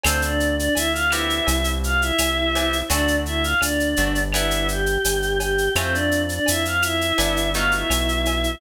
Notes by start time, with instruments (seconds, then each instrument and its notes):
0.03 synth bass 1 D2, choir aahs C4 C5, acoustic guitar (steel) C4 D4 F4 A4, cowbell, claves, shaker
0.22 choir aahs D4 D5, shaker
0.40 shaker
0.57 choir aahs D4 D5, shaker
0.75 synth bass 1 D2, choir aahs E4 E5, cowbell, shaker
0.92 choir aahs F4 F5, shaker
1.10 acoustic guitar (steel) B3 C4 E4 G4, choir aahs E4 E5, claves, shaker
1.30 shaker
1.47 synth bass 1 C2, cowbell, shaker
1.64 shaker
1.84 choir aahs F4 F5, shaker
2.01 choir aahs E4 E5, shaker
2.18 synth bass 1 C2, cowbell, claves, shaker
2.55 acoustic guitar (steel) B3 C4 E4 G4, cowbell, shaker
2.73 shaker
2.88 synth bass 1 D2, acoustic guitar (steel) A3 C4 D4 F#4, choir aahs D4 D5, cowbell, shaker
3.08 shaker
3.26 choir aahs E4 E5, shaker
3.43 choir aahs F4 F5, shaker
3.60 synth bass 1 D2, choir aahs D4 D5, cowbell, claves, shaker
3.80 shaker
3.96 synth bass 1 G1, acoustic guitar (steel) A3 C4 D4 F#4, shaker
4.15 shaker
4.33 acoustic guitar (steel) B3 D4 E4 G4, choir aahs E4 E5, cowbell, claves, shaker
4.51 shaker
4.68 choir aahs G4 G5, shaker
4.86 shaker
5.04 synth bass 1 G1, cowbell, shaker
5.22 shaker
5.39 choir aahs G4 G5, cowbell, shaker
5.58 shaker
5.75 synth bass 1 F2, acoustic guitar (steel) A3 C4 E4 F4, choir aahs C4 C5, cowbell, claves, shaker
5.92 choir aahs D4 D5, shaker
6.11 shaker
6.29 choir aahs D4 D5, shaker
6.46 synth bass 1 F2, choir aahs E4 E5, cowbell, shaker
6.65 choir aahs F4 F5, shaker
6.82 choir aahs E4 E5, claves, shaker
7.01 shaker
7.18 synth bass 1 G1, acoustic guitar (steel) G3 B3 D4 E4, cowbell, shaker
7.37 shaker
7.54 acoustic guitar (steel) F#3 A3 B3 D#4, choir aahs F4 F5, shaker
7.71 choir aahs E4 E5, shaker
7.90 synth bass 1 B1, cowbell, claves, shaker
8.08 shaker
8.25 cowbell, shaker
8.44 shaker